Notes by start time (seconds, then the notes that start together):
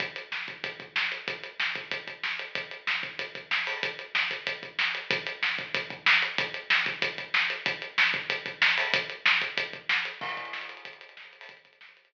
0.00 kick, closed hi-hat
0.16 closed hi-hat
0.32 snare
0.48 kick, closed hi-hat
0.64 kick, closed hi-hat
0.80 kick, closed hi-hat
0.96 snare
1.12 closed hi-hat
1.28 kick, closed hi-hat
1.43 closed hi-hat
1.60 snare
1.75 kick, closed hi-hat
1.91 kick, closed hi-hat
2.07 kick, closed hi-hat
2.23 snare
2.39 closed hi-hat
2.55 kick, closed hi-hat
2.71 closed hi-hat
2.87 snare
3.03 kick, closed hi-hat
3.19 kick, closed hi-hat
3.35 kick, closed hi-hat
3.51 snare
3.67 open hi-hat
3.83 kick, closed hi-hat
3.99 closed hi-hat
4.15 snare
4.31 kick, closed hi-hat
4.47 kick, closed hi-hat
4.63 kick, closed hi-hat
4.79 snare
4.95 closed hi-hat
5.11 kick, closed hi-hat
5.27 closed hi-hat
5.43 snare
5.59 kick, closed hi-hat
5.74 kick, closed hi-hat
5.90 kick, closed hi-hat
6.06 snare
6.22 closed hi-hat
6.38 kick, closed hi-hat
6.54 closed hi-hat
6.70 snare
6.86 kick, closed hi-hat
7.02 kick, closed hi-hat
7.18 kick, closed hi-hat
7.34 snare
7.50 closed hi-hat
7.66 kick, closed hi-hat
7.82 closed hi-hat
7.98 snare
8.14 kick, closed hi-hat
8.30 kick, closed hi-hat
8.46 kick, closed hi-hat
8.62 snare
8.78 open hi-hat
8.94 kick, closed hi-hat
9.10 closed hi-hat
9.26 snare
9.41 kick, closed hi-hat
9.57 kick, closed hi-hat
9.73 kick, closed hi-hat
9.89 snare
10.05 closed hi-hat
10.21 kick, crash
10.29 closed hi-hat
10.37 kick, closed hi-hat
10.45 closed hi-hat
10.53 snare
10.61 closed hi-hat
10.69 closed hi-hat
10.77 closed hi-hat
10.85 kick, closed hi-hat
10.93 closed hi-hat
11.01 closed hi-hat
11.09 closed hi-hat
11.17 snare
11.25 closed hi-hat
11.33 closed hi-hat
11.41 open hi-hat
11.49 kick, closed hi-hat
11.57 closed hi-hat
11.65 kick, closed hi-hat
11.73 closed hi-hat
11.81 snare
11.89 closed hi-hat
11.97 closed hi-hat
12.05 closed hi-hat